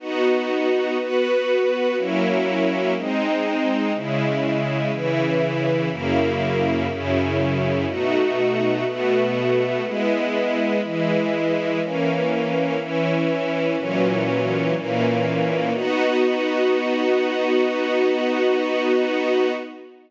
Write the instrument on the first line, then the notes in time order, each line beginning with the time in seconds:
string ensemble 1
0.00 B3 D#4 F#4
0.99 B3 F#4 B4
1.96 F#3 A#3 C#4 E4
2.95 G#3 C4 D#4
3.94 C#3 G#3 E4
4.92 C#3 E3 E4
5.90 F#2 C#3 A#3 E4
6.89 F#2 C#3 C#4 E4
7.87 B2 A3 D#4 F#4
8.85 B2 A3 B3 F#4
9.83 G#3 B3 E4
10.82 E3 G#3 E4
11.81 E3 A#3 C#4
12.78 E3 C#4 E4
13.77 A#2 E3 F#3 C#4
14.75 A#2 E3 A#3 C#4
15.74 B3 D#4 F#4